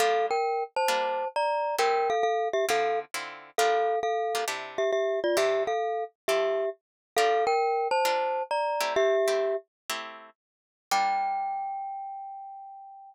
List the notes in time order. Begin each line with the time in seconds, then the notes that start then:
0.00 G3 A#3 D4 F4 A4 F5
0.31 A#4 G5
0.76 C5 A5
0.88 G3 A#3 D4 F4
1.36 D5 A#5
1.79 A3 C4 E4 G4 A#4 G5
2.10 A4 F5
2.23 A4 F5
2.53 G4 E5
2.69 D3 C4 E4 F4 A4 F5
3.14 D3 C4 E4 F4
3.58 G3 A#3 D4 F4 A4 F5
4.03 A4 F5
4.35 G3 A#3 D4 F4
4.48 C3 D4 E4 G4
4.78 G4 E5
4.93 G4 E5
5.24 F4 D5
5.37 C3 D4 E4 G4 E5
5.67 A4 F5
6.28 F3 E4 G4 A4 E5
7.17 G3 D4 F4 A4 A#4 F5
7.47 A#4 G5
7.91 C5 A5
8.05 G3 D4 F4 A#4
8.51 D5 A#5
8.81 A3 C4 E4 G4
8.96 G4 E5
9.28 A3 C4 E4 G4
9.90 A3 C4 E4 G4
10.91 G3 A#3 D4 F4 G5